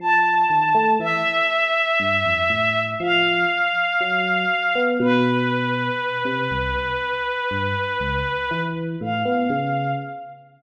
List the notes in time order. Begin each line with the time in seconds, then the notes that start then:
0.00 F3 A5
0.50 D#3
0.75 A3
1.00 E3 E5
2.00 G2
2.26 F2
2.50 A2
3.00 F3 F5
4.01 F#3
4.75 B3
5.00 B2 B4
6.25 C3
6.51 C2
6.75 C2
7.51 G2
8.00 C#2
8.51 E3
9.01 A2 F5
9.25 B3
9.50 C#3